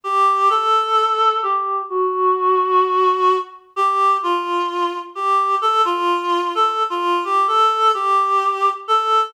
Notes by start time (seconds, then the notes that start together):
0.04 G4
0.50 A4
1.43 G4
1.89 F#4
3.76 G4
4.23 F4
5.15 G4
5.62 A4
5.85 F4
6.55 A4
6.90 F4
7.24 G4
7.47 A4
7.94 G4
8.88 A4